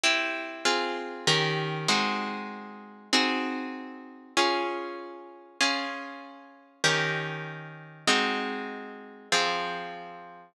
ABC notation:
X:1
M:4/4
L:1/8
Q:1/4=97
K:Db
V:1 name="Orchestral Harp"
[C=E=G]2 | [CFA]2 [E,D=GB]2 [A,CE_G]4 | [CEGA]4 [DFA]4 | [DFA]4 [E,D=GB]4 |
[A,CEG]4 [F,CA]4 |]